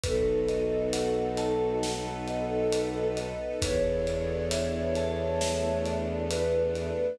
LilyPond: <<
  \new Staff \with { instrumentName = "Flute" } { \time 4/4 \key a \major \tempo 4 = 67 a'1 | cis''2. b'4 | }
  \new Staff \with { instrumentName = "Vibraphone" } { \time 4/4 \key a \major b'8 dis''8 fis''8 a''8 fis''8 dis''8 b'8 dis''8 | b'8 d''8 e''8 a''8 e''8 d''8 b'8 d''8 | }
  \new Staff \with { instrumentName = "Violin" } { \clef bass \time 4/4 \key a \major b,,1 | e,1 | }
  \new Staff \with { instrumentName = "String Ensemble 1" } { \time 4/4 \key a \major <b dis' fis' a'>2 <b dis' a' b'>2 | <b d' e' a'>2 <a b d' a'>2 | }
  \new DrumStaff \with { instrumentName = "Drums" } \drummode { \time 4/4 <hh bd>8 hh8 hh8 hh8 sn8 hh8 hh8 hh8 | <hh bd>8 hh8 hh8 hh8 sn8 hh8 hh8 hh8 | }
>>